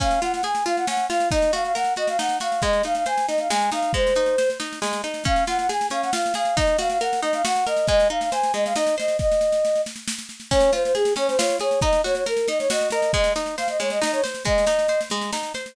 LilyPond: <<
  \new Staff \with { instrumentName = "Flute" } { \time 3/4 \key des \major \tempo 4 = 137 f''8 ges''16 ges''16 aes''8 f''16 ges''16 ges''8 f''8 | ees''8 f''16 f''16 ges''8 ees''16 f''16 ges''8 f''8 | ees''8 f''16 f''16 aes''8 ees''16 f''16 aes''8 f''8 | c''4. r4. |
f''8 ges''16 ges''16 aes''8 f''16 ges''16 f''8 f''8 | ees''8 f''16 f''16 ges''8 ees''16 f''16 ges''8 ees''8 | ees''8 f''16 f''16 aes''8 ees''16 f''16 ees''8 ees''8 | ees''4. r4. |
des''8 c''16 c''16 aes'8 des''16 c''16 des''8 des''8 | ees''8 des''16 des''16 bes'8 ees''16 des''16 ees''8 ees''8 | ees''8 r8 f''16 ees''16 des''16 ees''16 ees''16 des''16 r8 | ees''4. r4. | }
  \new Staff \with { instrumentName = "Acoustic Guitar (steel)" } { \time 3/4 \key des \major des'8 f'8 aes'8 f'8 des'8 f'8 | ees'8 ges'8 bes'8 ges'8 ees'8 ges'8 | aes8 ees'8 c''8 ees'8 aes8 ees'8 | aes8 ees'8 c''8 ees'8 aes8 ees'8 |
des'8 f'8 aes'8 des'8 f'8 aes'8 | ees'8 ges'8 bes'8 ees'8 ges'8 bes'8 | aes8 ees'8 c''8 aes8 ees'8 c''8 | r2. |
des'8 f'8 aes'8 des'8 f'8 aes'8 | ees'8 ges'8 bes'8 ees'8 ges'8 bes'8 | aes8 ees'8 c''8 aes8 ees'8 c''8 | aes8 ees'8 c''8 aes8 ees'8 c''8 | }
  \new DrumStaff \with { instrumentName = "Drums" } \drummode { \time 3/4 <bd sn>16 sn16 sn16 sn16 sn16 sn16 sn16 sn16 sn16 sn16 sn16 sn16 | <bd sn>16 sn16 sn16 sn16 sn16 sn16 sn16 sn16 sn16 sn16 sn16 sn16 | <bd sn>16 sn16 sn16 sn16 sn16 sn16 sn16 sn16 sn16 sn16 sn16 sn16 | <bd sn>16 sn16 sn16 sn16 sn16 sn16 sn16 sn16 sn16 sn16 sn16 sn16 |
<bd sn>16 sn16 sn16 sn16 sn16 sn16 sn16 sn16 sn16 sn16 sn16 sn16 | <bd sn>16 sn16 sn16 sn16 sn16 sn16 sn16 sn16 sn16 sn16 sn16 sn16 | <bd sn>16 sn8 sn16 sn16 sn16 sn16 sn16 sn16 sn16 sn16 sn16 | <bd sn>16 sn16 sn16 sn16 sn16 sn16 sn16 sn16 sn16 sn16 sn16 sn16 |
<bd sn>16 sn16 sn16 sn16 sn16 sn16 sn16 sn16 sn16 sn16 sn16 sn16 | <bd sn>16 sn16 sn16 sn16 sn16 sn16 sn16 sn16 sn16 sn16 sn16 sn16 | <bd sn>16 sn16 sn16 sn16 sn16 sn16 sn16 sn16 sn16 sn16 sn16 sn16 | <bd sn>16 sn16 sn16 sn16 sn16 sn16 sn16 sn16 sn16 sn16 sn16 sn16 | }
>>